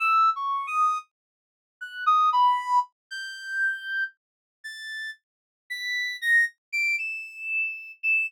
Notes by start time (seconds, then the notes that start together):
0.00 E6
0.36 C#6
0.67 D#6
1.81 F#6
2.06 D#6
2.33 B5
3.11 G6
4.64 A6
5.70 B6
6.22 A#6
6.72 D7
6.98 E7
8.03 E7